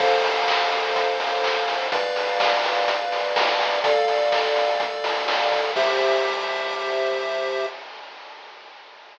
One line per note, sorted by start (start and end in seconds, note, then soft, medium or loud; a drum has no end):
0.00 1.77 F2 medium
0.00 1.88 A4 medium
0.00 1.88 C5 loud
0.00 1.88 F5 loud
0.00 kick loud
0.00 crash loud
0.24 open hi-hat medium
0.48 kick medium
0.48 clap loud
0.72 open hi-hat medium
0.96 kick medium
0.96 closed hi-hat loud
1.20 open hi-hat medium
1.44 kick medium
1.44 clap loud
1.68 open hi-hat medium
1.92 3.69 B1 loud
1.92 3.80 B4 medium
1.92 3.80 D5 medium
1.92 3.80 F5 medium
1.92 kick loud
1.92 closed hi-hat loud
2.16 open hi-hat medium
2.40 kick medium
2.40 snare loud
2.64 open hi-hat loud
2.88 kick medium
2.88 closed hi-hat loud
3.12 open hi-hat medium
3.36 kick loud
3.36 snare loud
3.60 open hi-hat medium
3.84 5.60 D2 medium
3.84 5.72 A4 medium
3.84 5.72 D5 loud
3.84 5.72 F5 medium
3.84 kick loud
3.84 closed hi-hat loud
4.08 open hi-hat medium
4.32 kick medium
4.32 snare loud
4.56 open hi-hat medium
4.80 kick loud
4.80 closed hi-hat loud
5.04 open hi-hat loud
5.28 snare loud
5.52 kick loud
5.52 open hi-hat medium
5.76 7.66 C2 loud
5.76 7.66 G4 loud
5.76 7.66 C5 loud
5.76 7.66 E5 loud
5.76 kick loud
5.76 crash loud